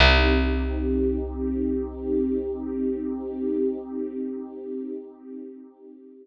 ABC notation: X:1
M:4/4
L:1/8
Q:1/4=68
K:Cdor
V:1 name="Pad 2 (warm)"
[CEG]8- | [CEG]8 |]
V:2 name="Electric Bass (finger)" clef=bass
C,,8- | C,,8 |]